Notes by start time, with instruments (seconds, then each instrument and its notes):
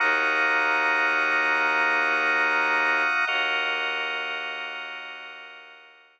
0.00 violin D#2, drawbar organ A#3 D#4 F#4 F#5 A#5 D#6
3.27 violin D#2, drawbar organ A#3 F#4 A#4 D#5 F#5 D#6